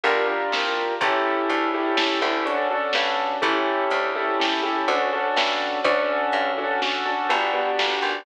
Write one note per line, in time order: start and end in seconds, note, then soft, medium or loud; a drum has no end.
0.03 0.45 G1 loud
0.03 0.26 D4 medium
0.03 0.26 F4 loud
0.03 0.26 G4 medium
0.03 0.26 A#4 loud
0.03 closed hi-hat medium
0.27 0.94 D4 medium
0.27 0.94 F4 medium
0.27 0.94 G4 medium
0.27 0.94 A#4 medium
0.52 0.93 C2 medium
0.52 snare medium
1.01 1.42 A1 loud
1.01 1.69 C#4 medium
1.01 1.69 E4 loud
1.01 1.69 G4 medium
1.01 1.69 A4 loud
1.01 kick loud
1.01 closed hi-hat loud
1.49 2.18 D2 loud
1.49 closed hi-hat medium
1.74 1.96 C#4 medium
1.74 1.96 E4 medium
1.74 1.96 G4 medium
1.74 1.96 A4 medium
1.97 2.19 C#4 medium
1.97 2.19 E4 medium
1.97 2.19 G4 medium
1.97 2.19 A4 medium
1.97 snare loud
2.21 2.87 D2 loud
2.21 2.43 C#4 medium
2.21 2.43 E4 medium
2.21 2.43 G4 medium
2.21 2.43 A4 medium
2.46 2.68 C#4 medium
2.46 2.68 D4 medium
2.46 2.68 F#4 medium
2.46 2.68 A4 medium
2.46 closed hi-hat medium
2.71 3.37 C#4 medium
2.71 3.37 D4 medium
2.71 3.37 F#4 medium
2.71 3.37 A4 medium
2.93 3.36 G2 loud
2.93 snare medium
3.42 3.84 A1 loud
3.42 4.08 C#4 medium
3.42 4.08 E4 medium
3.42 4.08 G4 medium
3.42 4.08 A4 medium
3.42 kick medium
3.42 closed hi-hat medium
3.90 4.73 D2 loud
3.90 closed hi-hat medium
4.15 4.38 C#4 medium
4.15 4.38 E4 medium
4.15 4.38 G4 medium
4.15 4.38 A4 medium
4.40 4.62 C#4 medium
4.40 4.62 E4 medium
4.40 4.62 G4 medium
4.40 4.62 A4 medium
4.40 snare loud
4.63 4.86 C#4 medium
4.63 4.86 E4 medium
4.63 4.86 G4 medium
4.63 4.86 A4 medium
4.88 5.29 D2 loud
4.88 5.10 C#4 medium
4.88 5.10 D4 medium
4.88 5.10 F#4 medium
4.88 5.10 A4 medium
4.88 closed hi-hat medium
5.13 5.80 C#4 medium
5.13 5.80 D4 medium
5.13 5.80 F#4 medium
5.13 5.80 A4 medium
5.36 5.78 G2 medium
5.36 snare loud
5.84 6.25 D2 loud
5.84 6.52 C#4 loud
5.84 6.52 D4 loud
5.84 6.52 F#4 medium
5.84 6.52 A4 medium
5.84 kick loud
5.84 closed hi-hat medium
6.32 7.15 G2 loud
6.32 closed hi-hat medium
6.58 6.80 C#4 medium
6.58 6.80 D4 medium
6.58 6.80 F#4 medium
6.58 6.80 A4 medium
6.82 7.04 C#4 medium
6.82 7.04 D4 medium
6.82 7.04 F#4 medium
6.82 7.04 A4 medium
6.82 snare medium
7.05 7.28 C#4 medium
7.05 7.28 D4 medium
7.05 7.28 F#4 medium
7.05 7.28 A4 medium
7.29 7.71 G1 loud
7.29 7.51 B3 medium
7.29 7.51 D4 medium
7.29 7.51 F#4 medium
7.29 7.51 G4 medium
7.29 closed hi-hat medium
7.53 8.20 B3 medium
7.53 8.20 D4 medium
7.53 8.20 F#4 medium
7.53 8.20 G4 medium
7.79 8.01 G1 medium
7.79 snare loud
8.02 8.24 G#1 medium